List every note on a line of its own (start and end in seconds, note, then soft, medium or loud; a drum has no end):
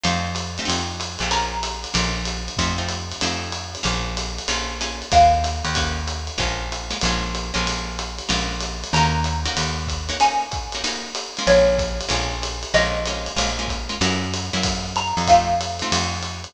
0.04 0.59 F2 medium
0.04 0.29 A3 loud
0.04 0.29 C4 loud
0.04 0.29 D#4 loud
0.04 0.29 F4 loud
0.04 ride loud
0.35 hi-hat pedal loud
0.35 ride loud
0.58 0.65 A3 loud
0.58 0.65 C4 loud
0.58 0.65 D#4 loud
0.58 0.65 F4 medium
0.58 ride medium
0.65 1.17 F2 medium
0.65 0.90 A3 loud
0.65 0.90 C4 loud
0.65 0.90 D#4 loud
0.65 0.90 F4 loud
0.70 ride loud
1.00 hi-hat pedal loud
1.00 ride loud
1.19 1.86 A#1 medium
1.19 1.30 A3 loud
1.19 1.30 C4 loud
1.19 1.30 D#4 loud
1.19 1.30 F4 loud
1.19 ride medium
1.31 1.56 A#3 loud
1.31 1.56 C#4 loud
1.31 1.56 F4 loud
1.31 1.56 G#4 loud
1.31 2.56 A#5 soft
1.31 ride loud
1.63 hi-hat pedal loud
1.63 ride loud
1.84 ride medium
1.94 2.49 A#1 medium
1.94 2.19 A#3 loud
1.94 2.19 C#4 loud
1.94 2.19 F4 loud
1.94 2.19 G#4 loud
1.94 ride loud
2.25 hi-hat pedal loud
2.25 ride loud
2.48 ride medium
2.57 3.13 F2 medium
2.57 2.74 A3 loud
2.57 2.74 C4 loud
2.57 2.74 D#4 loud
2.57 2.74 F4 loud
2.57 kick medium
2.57 ride loud
2.78 2.97 A3 loud
2.78 2.97 C4 medium
2.78 2.97 D#4 loud
2.78 2.97 F4 loud
2.88 hi-hat pedal loud
2.88 ride loud
3.12 ride medium
3.21 3.77 F2 medium
3.21 3.48 A3 loud
3.21 3.48 C4 loud
3.21 3.48 D#4 loud
3.21 3.48 F4 loud
3.21 ride loud
3.52 hi-hat pedal loud
3.52 ride loud
3.75 ride medium
3.83 4.40 A#1 loud
3.83 4.08 A#3 loud
3.83 4.08 C#4 loud
3.83 4.08 F4 loud
3.83 4.08 G#4 loud
3.83 ride loud
4.17 hi-hat pedal medium
4.17 ride loud
4.38 ride medium
4.48 5.03 A#1 medium
4.48 4.73 A#3 loud
4.48 4.73 C#4 loud
4.48 4.73 F4 loud
4.48 4.73 G#4 loud
4.48 ride loud
4.81 5.06 A#3 medium
4.81 5.06 C#4 loud
4.81 5.06 F4 loud
4.81 5.06 G#4 loud
4.81 hi-hat pedal loud
4.81 ride loud
5.02 ride medium
5.12 5.62 D#2 medium
5.12 5.37 A#3 loud
5.12 5.37 C#4 loud
5.12 5.37 D#4 loud
5.12 5.37 F#4 loud
5.12 6.37 F5 medium
5.12 kick medium
5.12 ride loud
5.44 hi-hat pedal loud
5.44 ride loud
5.64 6.30 D#2 loud
5.64 ride medium
5.75 6.01 A#3 loud
5.75 6.01 C#4 loud
5.75 6.01 D#4 loud
5.75 6.01 F#4 loud
5.75 kick medium
5.75 ride loud
6.07 hi-hat pedal loud
6.07 ride loud
6.27 ride medium
6.38 6.94 A#1 medium
6.38 6.63 G#3 loud
6.38 6.63 A#3 loud
6.38 6.63 C#4 loud
6.38 6.63 F4 loud
6.38 kick medium
6.38 ride loud
6.72 hi-hat pedal loud
6.72 ride loud
6.90 6.98 G#3 medium
6.90 6.98 A#3 medium
6.90 6.98 C#4 loud
6.90 6.98 F4 loud
6.90 ride loud
7.01 7.52 A#1 medium
7.01 7.30 G#3 loud
7.01 7.30 A#3 loud
7.01 7.30 C#4 loud
7.01 7.30 F4 loud
7.01 ride loud
7.35 hi-hat pedal loud
7.35 ride loud
7.54 8.21 A#1 medium
7.54 7.90 G#3 loud
7.54 7.90 A#3 loud
7.54 7.90 C#4 loud
7.54 7.90 F4 loud
7.54 ride medium
7.67 ride loud
7.99 hi-hat pedal loud
7.99 ride loud
8.18 ride medium
8.29 8.84 A#1 medium
8.29 8.54 G#3 loud
8.29 8.54 A#3 loud
8.29 8.54 C#4 loud
8.29 8.54 F4 loud
8.29 ride loud
8.60 hi-hat pedal loud
8.60 ride loud
8.84 ride loud
8.93 9.48 D#2 medium
8.93 9.21 A#3 loud
8.93 9.21 C#4 loud
8.93 9.21 D#4 loud
8.93 9.21 F#4 loud
8.93 10.19 A#5 medium
8.93 ride loud
9.24 hi-hat pedal loud
9.24 ride loud
9.45 9.82 A#3 loud
9.45 9.82 C#4 loud
9.45 9.82 D#4 loud
9.45 9.82 F#4 loud
9.45 ride loud
9.57 10.11 D#2 medium
9.57 ride loud
9.87 kick medium
9.87 hi-hat pedal loud
9.87 ride loud
10.09 10.17 A#3 loud
10.09 10.17 C#4 loud
10.09 10.17 D#4 loud
10.09 10.17 F#4 loud
10.09 ride medium
10.20 10.46 A#3 loud
10.20 10.46 C#4 loud
10.20 10.46 D#4 loud
10.20 10.46 F#4 loud
10.20 11.39 G#5 medium
10.20 ride loud
10.51 kick medium
10.51 hi-hat pedal loud
10.51 ride medium
10.72 10.82 A#3 loud
10.72 10.82 C#4 medium
10.72 10.82 D#4 loud
10.72 10.82 F#4 loud
10.72 ride medium
10.84 11.09 A#3 loud
10.84 11.09 C#4 loud
10.84 11.09 D#4 loud
10.84 11.09 F#4 loud
10.84 ride loud
11.15 hi-hat pedal loud
11.15 ride loud
11.37 11.75 G#3 loud
11.37 11.75 A#3 loud
11.37 11.75 C#4 loud
11.37 11.75 F4 loud
11.37 ride medium
11.47 12.02 A#1 medium
11.47 12.68 C#5 medium
11.47 ride loud
11.78 kick medium
11.78 hi-hat pedal medium
11.78 ride loud
12.01 ride loud
12.09 12.65 A#1 medium
12.09 12.34 G#3 loud
12.09 12.34 A#3 loud
12.09 12.34 C#4 loud
12.09 12.34 F4 loud
12.09 ride loud
12.42 hi-hat pedal medium
12.42 ride loud
12.63 ride medium
12.74 13.29 A#1 medium
12.74 12.99 G#3 loud
12.74 12.99 A#3 loud
12.74 12.99 C#4 loud
12.74 12.99 F4 loud
12.74 13.94 D#5 medium
12.74 ride loud
13.05 13.32 G#3 loud
13.05 13.32 A#3 loud
13.05 13.32 C#4 loud
13.05 13.32 F4 medium
13.05 hi-hat pedal loud
13.05 ride loud
13.26 ride medium
13.36 13.92 A#1 medium
13.36 13.51 G#3 loud
13.36 13.51 A#3 loud
13.36 13.51 C#4 loud
13.36 13.51 F4 loud
13.36 ride loud
13.59 13.78 G#3 loud
13.59 13.78 A#3 loud
13.59 13.78 C#4 loud
13.59 13.78 F4 loud
13.68 kick medium
13.68 hi-hat pedal loud
13.68 ride medium
13.89 13.97 G#3 loud
13.89 13.97 A#3 loud
13.89 13.97 C#4 loud
13.89 13.97 F4 loud
13.89 ride medium
14.01 14.50 F#2 loud
14.01 14.26 A#3 loud
14.01 14.26 C#4 loud
14.01 14.26 E4 loud
14.01 14.26 F#4 loud
14.01 ride loud
14.34 hi-hat pedal medium
14.34 ride loud
14.53 15.13 F#2 medium
14.53 14.89 A#3 loud
14.53 14.89 C#4 loud
14.53 14.89 E4 loud
14.53 14.89 F#4 loud
14.53 ride medium
14.63 kick medium
14.63 ride loud
14.96 15.27 A#5 medium
14.96 hi-hat pedal medium
14.96 ride loud
15.17 15.83 F2 medium
15.17 ride medium
15.27 15.54 A3 loud
15.27 15.54 C4 loud
15.27 15.54 D#4 loud
15.27 15.54 F4 loud
15.27 16.50 F5 medium
15.27 kick medium
15.27 ride loud
15.61 hi-hat pedal loud
15.61 ride loud
15.79 16.18 A3 loud
15.79 16.18 C4 loud
15.79 16.18 D#4 loud
15.79 16.18 F4 loud
15.79 ride medium
15.92 16.47 F2 medium
15.92 ride loud
16.23 hi-hat pedal medium
16.23 ride medium
16.44 ride medium